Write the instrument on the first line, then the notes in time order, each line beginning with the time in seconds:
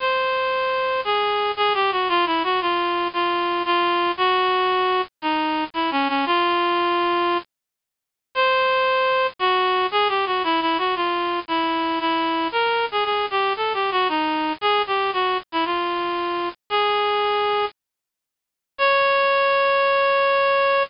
clarinet
0.00 C5
1.05 G#4
1.57 G#4
1.74 G4
1.92 F#4
2.09 F4
2.26 E4
2.44 F#4
2.61 F4
3.13 F4
3.65 F4
4.17 F#4
5.22 D#4
5.74 E4
5.91 C#4
6.08 C#4
6.26 F4
8.35 C5
9.39 F#4
9.91 G#4
10.09 G4
10.26 F#4
10.44 E4
10.61 E4
10.78 F#4
10.96 F4
11.48 E4
12.00 E4
12.52 A#4
12.91 G#4
13.04 G#4
13.31 G4
13.57 A4
13.74 G4
13.91 F#4
14.09 D#4
14.61 G#4
14.87 G4
15.13 F#4
15.52 E4
15.65 F4
16.70 G#4
18.78 C#5